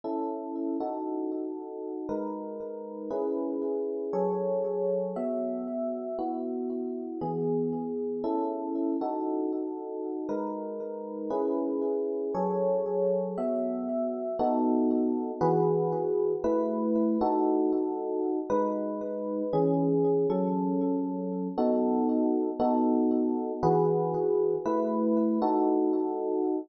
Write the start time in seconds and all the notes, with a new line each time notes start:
0.04 C#4 E4 A4
0.80 D#4 F#4 A4
2.09 G#3 D#4 A#4 B4
3.10 C#4 E4 G#4 B4
4.13 F#3 G#4 A4 C#5
5.16 B3 F#4 E5
6.19 B3 E4 F#4
7.21 E3 B3 G#4
8.24 C#4 E4 A4
9.01 D#4 F#4 A4
10.29 G#3 D#4 A#4 B4
11.30 C#4 E4 G#4 B4
12.35 F#3 G#4 A4 C#5
13.38 B3 F#4 E5
14.39 B3 D#4 F#4 A4
15.41 E3 F#4 G#4 B4
16.44 A3 E4 B4
17.21 D#4 F#4 A4
18.50 G#3 D#4 B4
19.53 E3 C#4 G#4
20.30 F#3 C#4 A4
21.58 B3 D#4 F#4 A4
22.60 B3 D#4 F#4 A4
23.63 E3 F#4 G#4 B4
24.65 A3 E4 B4
25.42 D#4 F#4 A4